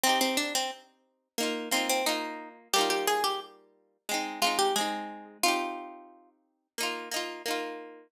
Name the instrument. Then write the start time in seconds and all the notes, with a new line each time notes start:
acoustic guitar (steel)
0.04 C4 D#4
0.09 G4
0.21 C4
0.37 D4
0.55 C4
1.38 A#3 D#4
1.43 F4
1.71 A#3 C4 D#4
1.76 F4
1.89 C4
2.06 A#3 D#4 F4
2.73 G3 A#3 G4
2.78 D#4 F4
2.90 G4
3.07 G#4
3.24 G4
4.09 G#3 C4
4.14 D#4
4.42 G#3 C4 F4
4.47 D#4
4.59 G4
4.76 G#3 C4 G#4
4.81 D#4
5.43 C4 D#4 F4
5.48 G4
6.78 A#3 D#4
6.83 F4
7.11 A#3 D#4
7.16 F4
7.46 A#3 D#4
7.51 F4